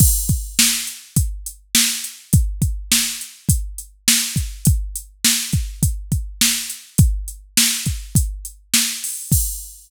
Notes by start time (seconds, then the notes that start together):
0.00 kick, crash
0.29 kick, closed hi-hat
0.59 snare
0.87 closed hi-hat
1.16 kick, closed hi-hat
1.46 closed hi-hat
1.75 snare
2.04 closed hi-hat
2.33 kick, closed hi-hat
2.62 kick, closed hi-hat
2.92 snare
3.21 closed hi-hat
3.49 kick, closed hi-hat
3.78 closed hi-hat
4.08 snare
4.36 kick, closed hi-hat
4.65 kick, closed hi-hat
4.96 closed hi-hat
5.25 snare
5.53 kick, closed hi-hat
5.83 kick, closed hi-hat
6.12 kick, closed hi-hat
6.41 snare
6.70 closed hi-hat
6.98 kick, closed hi-hat
7.28 closed hi-hat
7.57 snare
7.86 kick, closed hi-hat
8.15 kick, closed hi-hat
8.45 closed hi-hat
8.74 snare
9.04 open hi-hat
9.32 kick, crash